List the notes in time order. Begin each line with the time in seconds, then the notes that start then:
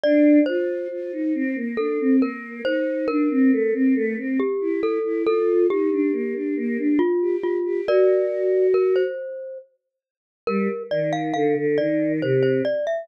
0.03 D4 D5
0.46 F4 C5
0.91 F4
1.13 D#4
1.35 C4
1.56 A#3
1.77 D4 A4
2.00 C4
2.22 A#3 A#4
2.65 D#4 C5
3.08 D4 A#4
3.30 C4
3.52 A3
3.74 C4
3.95 A3
4.17 C4
4.39 G4
4.61 E4
4.83 A4
5.04 E4
5.26 F4 A4
5.69 D#4 G4
5.91 D4
6.13 A#3
6.35 D4
6.57 A#3
6.78 D4
6.99 F4
7.21 G4
7.43 F4
7.65 G4
7.87 F#4 A#4 D5
8.74 A#4
8.96 C5
10.47 G3 A#4
10.91 D#3 D5
11.13 F5
11.34 D3 F5
11.57 D3
11.78 D#3 D5
12.22 C3 C5
12.43 C5
12.65 D5
12.87 E5